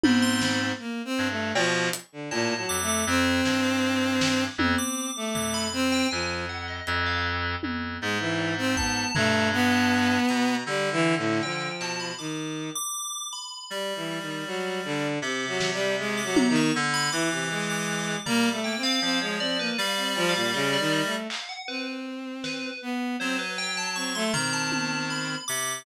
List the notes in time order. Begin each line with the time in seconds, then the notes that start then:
0.03 G#2 C4 B5, high tom
0.22 C6
0.41 B5, snare
0.79 A#3
1.05 C4
1.18 G2
1.30 A3
1.55 B2 F3 C#6, cowbell
1.93 closed hi-hat
2.12 D3
2.31 A2 A#2 A5, cowbell
2.57 F#3
2.69 F2 D6
2.82 A3
2.88 D6
3.06 F2 C4
3.45 G2, snare
3.64 D6
4.21 snare
4.58 F2 C4, high tom
4.78 D6
5.16 A3 D6
5.34 F2 D6, floor tom
5.54 B5
5.73 C4
5.92 G5
6.11 F2 F3 G#5
6.49 F#5
6.68 D#5
6.87 F2, closed hi-hat
7.06 F5
7.63 F2, high tom
8.01 G#2 G#3
8.20 E3
8.39 cowbell
8.58 C4
8.77 B3 A5, kick
9.15 G2 A3 A#5, floor tom
9.53 B3
9.72 A5
10.29 B2 A#5, closed hi-hat
10.66 D3 G3
10.92 E3
11.18 A2
11.43 F3 G5, cowbell
11.81 B2 A5, clap
12.00 B5
12.19 D#3 D6
12.75 D6
13.33 B5
13.70 G3
13.96 E3
14.21 D#3
14.46 F#3
14.84 D3
15.22 C3 D6
15.48 F#3
15.60 snare
15.73 G3
15.99 G#3
16.17 D6
16.24 F#3
16.36 A#5, high tom
16.49 D#3
16.56 C#6
16.75 D3
16.94 B5
17.12 E3 D6
17.31 C3
17.50 G#3 D6
17.69 D6
18.25 G3 A#3 A#5, floor tom
18.45 D6
18.52 A3
18.64 A#3 G5
18.77 C4
18.83 C4 F5
19.02 F3 C4, cowbell
19.21 G#3 C#5
19.40 C4 D5
19.59 A#3 B4
19.78 G3 F5
19.97 C4
20.04 D5
20.16 F3, cowbell
20.29 F5
20.35 A#2
20.54 C#3 D#5
20.73 D5
20.79 D#3
20.92 D#5
21.05 A3
21.30 F5, clap
21.49 F#5
21.68 C4 B4
22.44 B4, snare
22.82 B3
23.20 F#3 C4 C5
23.39 B4
23.58 G5
23.77 A5
23.96 C4 C#6
24.15 A3 C6
24.33 D#3 C4 A#5, floor tom
24.53 A5
24.72 high tom
25.10 B5
25.48 C3 D6